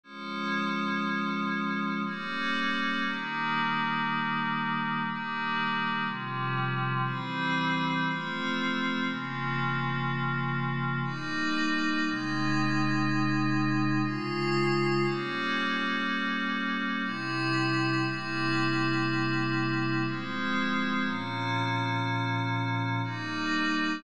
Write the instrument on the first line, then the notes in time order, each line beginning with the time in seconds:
pad 5 (bowed)
0.04 F3 G#3 C#4
2.05 G3 A#3 C#4
3.05 D#3 G3 A#3
5.04 D#3 G3 A#3
6.04 C3 F3 G3
7.04 E3 G3 C4
8.04 F3 A3 C4
9.04 C#3 F3 A#3
11.04 G3 A#3 D#4
12.03 C3 G#3 D#4
14.03 C#3 G#3 F4
15.04 G3 A#3 C#4
17.02 C3 G3 E4
18.04 C3 G3 A#3 E4
20.05 F3 G#3 C4
21.02 A#2 F3 C#4
23.04 G3 A#3 D#4